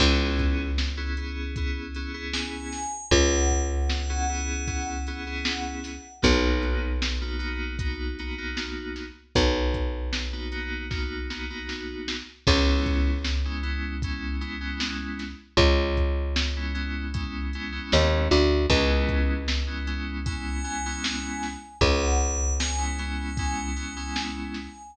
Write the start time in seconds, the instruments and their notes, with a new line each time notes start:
0.00 electric bass (finger) C#2, electric piano 2 B3 C#4 E4 G#4, kick, crash
0.39 kick, closed hi-hat
0.78 snare
0.97 electric piano 2 B3 C#4 E4 G#4
1.17 electric piano 2 B3 C#4 E4 G#4, closed hi-hat
1.56 electric piano 2 B3 C#4 E4 G#4, kick, closed hi-hat
1.94 electric piano 2 B3 C#4 E4 G#4, closed hi-hat
2.14 electric piano 2 B3 C#4 E4 G#4
2.33 tubular bells G#5, snare
2.72 snare, closed hi-hat
3.11 electric bass (finger) C#2, tubular bells F#5, kick, closed hi-hat
3.50 kick, closed hi-hat
3.89 snare
4.09 electric piano 2 B3 C#4 E4 G#4
4.29 electric piano 2 B3 C#4 E4 G#4, closed hi-hat
4.67 electric piano 2 B3 C#4 E4 G#4, kick, closed hi-hat
5.07 electric piano 2 B3 C#4 E4 G#4, closed hi-hat
5.26 electric piano 2 B3 C#4 E4 G#4
5.45 snare
5.84 snare, open hi-hat
6.22 electric bass (finger) B1, electric piano 2 A#3 B3 D#4 F#4, kick, closed hi-hat
6.63 closed hi-hat
7.02 snare
7.21 electric piano 2 A#3 B3 D#4 F#4
7.39 electric piano 2 A#3 B3 D#4 F#4, closed hi-hat
7.79 electric piano 2 A#3 B3 D#4 F#4, kick, closed hi-hat
8.19 electric piano 2 A#3 B3 D#4 F#4, closed hi-hat
8.38 electric piano 2 A#3 B3 D#4 F#4
8.57 snare
8.96 snare, closed hi-hat
9.35 electric bass (finger) B1, kick, closed hi-hat
9.74 kick, closed hi-hat
10.13 snare
10.33 electric piano 2 A#3 B3 D#4 F#4
10.51 electric piano 2 A#3 B3 D#4 F#4, closed hi-hat
10.90 electric piano 2 A#3 B3 D#4 F#4, kick, snare
11.30 electric piano 2 A#3 B3 D#4 F#4, snare
11.50 electric piano 2 A#3 B3 D#4 F#4
11.69 snare
12.08 snare
12.47 electric bass (finger) C#2, electric piano 2 G#3 B3 C#4 E4, kick, crash
12.86 kick, closed hi-hat
13.25 snare
13.45 electric piano 2 G#3 B3 C#4 E4
13.63 electric piano 2 G#3 B3 C#4 E4, closed hi-hat
14.02 electric piano 2 G#3 B3 C#4 E4, kick, closed hi-hat
14.41 electric piano 2 G#3 B3 C#4 E4, closed hi-hat
14.60 electric piano 2 G#3 B3 C#4 E4
14.80 snare
15.19 snare, closed hi-hat
15.57 electric bass (finger) C#2, kick, closed hi-hat
15.97 kick, closed hi-hat
16.36 snare
16.56 electric piano 2 G#3 B3 C#4 E4
16.74 electric piano 2 G#3 B3 C#4 E4, closed hi-hat
17.13 electric piano 2 G#3 B3 C#4 E4, kick, closed hi-hat
17.53 electric piano 2 G#3 B3 C#4 E4, closed hi-hat
17.72 electric piano 2 G#3 B3 C#4 E4
17.92 electric bass (finger) D#2, snare
18.31 electric bass (finger) D2, snare, closed hi-hat
18.70 electric bass (finger) C#2, electric piano 2 G#3 B3 C#4 E4, kick, closed hi-hat
19.08 kick, closed hi-hat
19.48 snare
19.67 electric piano 2 G#3 B3 C#4 E4
19.87 electric piano 2 G#3 B3 C#4 E4, closed hi-hat
20.26 electric piano 2 G#3 B3 C#4 E4, tubular bells G#5, kick, closed hi-hat
20.64 electric piano 2 G#3 B3 C#4 E4, closed hi-hat
20.86 electric piano 2 G#3 B3 C#4 E4
21.04 snare
21.43 snare, closed hi-hat
21.81 electric bass (finger) C#2, tubular bells F#5, kick, closed hi-hat
22.21 closed hi-hat
22.60 tubular bells G#5, snare
22.78 electric piano 2 G#3 B3 C#4 E4
22.99 electric piano 2 G#3 B3 C#4 E4, closed hi-hat
23.37 electric piano 2 G#3 B3 C#4 E4, kick, closed hi-hat
23.76 electric piano 2 G#3 B3 C#4 E4, closed hi-hat
23.96 electric piano 2 G#3 B3 C#4 E4
24.16 snare
24.54 snare, closed hi-hat